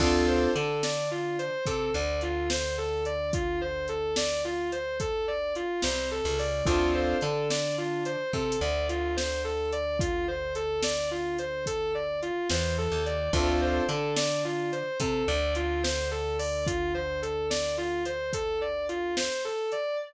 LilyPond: <<
  \new Staff \with { instrumentName = "Distortion Guitar" } { \time 12/8 \key d \minor \tempo 4. = 72 f'8 c''8 a'8 d''8 f'8 c''8 a'8 d''8 f'8 c''8 a'8 d''8 | f'8 c''8 a'8 d''8 f'8 c''8 a'8 d''8 f'8 c''8 a'8 d''8 | f'8 c''8 a'8 d''8 f'8 c''8 a'8 d''8 f'8 c''8 a'8 d''8 | f'8 c''8 a'8 d''8 f'8 c''8 a'8 d''8 f'8 c''8 a'8 d''8 |
f'8 c''8 a'8 d''8 f'8 c''8 a'8 d''8 f'8 c''8 a'8 d''8 | f'8 c''8 a'8 d''8 f'8 c''8 a'8 d''8 f'8 c''8 a'8 d''8 | }
  \new Staff \with { instrumentName = "Acoustic Grand Piano" } { \time 12/8 \key d \minor <c' d' f' a'>4 d'2 c'8 d2~ d8~ | d1~ d8 c8. cis8. | <c' d' f' a'>4 d'2 c'8 d2~ d8~ | d1~ d8 e8. ees8. |
<c' d' f' a'>4 d'2 c'8 d2~ d8~ | d1. | }
  \new Staff \with { instrumentName = "Electric Bass (finger)" } { \clef bass \time 12/8 \key d \minor d,4 d2 c8 d,2~ d,8~ | d,1~ d,8 c,8. cis,8. | d,4 d2 c8 d,2~ d,8~ | d,1~ d,8 e,8. ees,8. |
d,4 d2 c8 d,2~ d,8~ | d,1. | }
  \new DrumStaff \with { instrumentName = "Drums" } \drummode { \time 12/8 <cymc bd>4 hh8 sn4 hh8 <hh bd>4 hh8 sn4 hh8 | <hh bd>4 hh8 sn4 hh8 <hh bd>4 hh8 sn4 hho8 | <hh bd>4 hh8 sn4 hh8 \tuplet 3/2 { bd16 r16 hh16 r16 r16 r16 hh16 r16 r16 } sn4 hh8 | <hh bd>4 hh8 sn4 hh8 <hh bd>4 hh8 sn4 hh8 |
<hh bd>4 hh8 sn4 hh8 <hh bd>4 hh8 sn4 hho8 | <hh bd>4 hh8 sn4 hh8 <hh bd>4 hh8 sn4 hh8 | }
>>